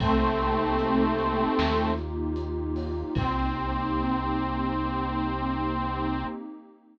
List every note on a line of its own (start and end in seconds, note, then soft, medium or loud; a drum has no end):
0.00 1.46 C2 medium
0.00 1.91 A3 loud
0.00 1.57 A#3 loud
0.00 1.91 C4 loud
0.00 1.57 C4 medium
0.00 1.57 D#4 loud
0.00 1.57 G4 loud
0.00 kick loud
0.00 crash loud
0.40 closed hi-hat medium
0.79 closed hi-hat loud
1.18 closed hi-hat medium
1.58 3.04 D#2 medium
1.58 3.14 A#3 medium
1.58 3.14 D#4 medium
1.58 3.14 F4 medium
1.58 3.14 G4 medium
1.58 snare loud
1.98 closed hi-hat medium
2.36 closed hi-hat loud
2.76 open hi-hat medium
3.15 6.24 C2 loud
3.15 6.25 A#3 loud
3.15 6.25 C4 loud
3.15 6.25 D#4 loud
3.15 6.25 G4 loud
3.15 kick loud
3.15 crash loud